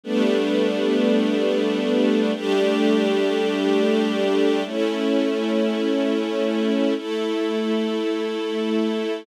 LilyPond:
\new Staff { \time 4/4 \key b \minor \tempo 4 = 52 <g a b d'>2 <g a d' g'>2 | <a cis' e'>2 <a e' a'>2 | }